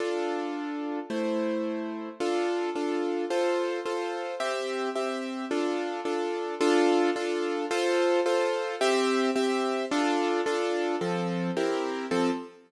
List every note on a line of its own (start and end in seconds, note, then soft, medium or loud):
0.00 0.99 D4 medium
0.00 0.99 F4 medium
0.00 0.99 A4 medium
1.10 2.09 A3 medium
1.10 2.09 E4 medium
1.10 2.09 C5 medium
2.20 2.70 D4 medium
2.20 2.70 F4 medium
2.20 2.70 A4 medium
2.75 3.25 D4 medium
2.75 3.25 F4 medium
2.75 3.25 A4 medium
3.30 3.80 F4 medium
3.30 3.80 A4 medium
3.30 3.80 C5 medium
3.86 4.35 F4 medium
3.86 4.35 A4 medium
3.86 4.35 C5 medium
4.40 4.90 C4 medium
4.40 4.90 G4 loud
4.40 4.90 E5 medium
4.96 5.45 C4 medium
4.96 5.45 G4 medium
4.96 5.45 E5 medium
5.51 6.00 D4 medium
5.51 6.00 F4 medium
5.51 6.00 A4 medium
6.05 6.55 D4 medium
6.05 6.55 F4 medium
6.05 6.55 A4 medium
6.61 7.10 D4 loud
6.61 7.10 F4 loud
6.61 7.10 A4 loud
7.16 7.65 D4 medium
7.16 7.65 F4 medium
7.16 7.65 A4 medium
7.71 8.20 F4 loud
7.71 8.20 A4 loud
7.71 8.20 C5 loud
8.26 8.75 F4 medium
8.26 8.75 A4 medium
8.26 8.75 C5 medium
8.81 9.31 C4 loud
8.81 9.31 G4 loud
8.81 9.31 E5 loud
9.36 9.85 C4 medium
9.36 9.85 G4 medium
9.36 9.85 E5 loud
9.91 10.41 D4 loud
9.91 10.41 F4 loud
9.91 10.41 A4 loud
10.46 10.96 D4 loud
10.46 10.96 F4 medium
10.46 10.96 A4 medium
11.01 11.51 F3 medium
11.01 11.51 C4 medium
11.01 11.51 A4 medium
11.57 12.06 C4 medium
11.57 12.06 E4 medium
11.57 12.06 G4 medium
11.57 12.06 A#4 medium
12.11 12.30 F3 loud
12.11 12.30 C4 medium
12.11 12.30 A4 loud